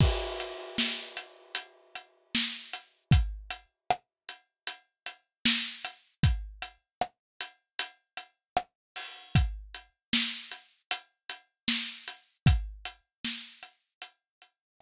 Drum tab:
CC |x-------|--------|--------|--------|
HH |-x-xxx-x|xx-xxx-x|xx-xxx-o|xx-xxx-x|
SD |--o---o-|--r---o-|--r---r-|--o---o-|
BD |o-------|o-------|o-------|o-------|

CC |--------|
HH |xx-xxx--|
SD |--o---r-|
BD |o-------|